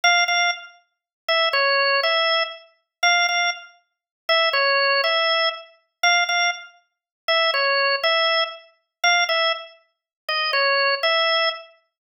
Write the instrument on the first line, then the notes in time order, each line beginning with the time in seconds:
drawbar organ
0.04 F5
0.28 F5
1.28 E5
1.53 C#5
2.03 E5
3.03 F5
3.29 F5
4.29 E5
4.53 C#5
5.04 E5
6.03 F5
6.29 F5
7.28 E5
7.54 C#5
8.04 E5
9.04 F5
9.29 E5
10.29 D#5
10.53 C#5
11.03 E5